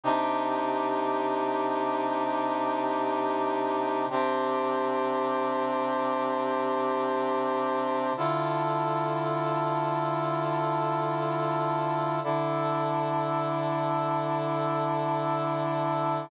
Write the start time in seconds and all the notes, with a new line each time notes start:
0.04 C3 D4 D#4 G4
4.10 C3 C4 D4 G4
8.17 D3 E4 F4 A4
12.24 D3 D4 E4 A4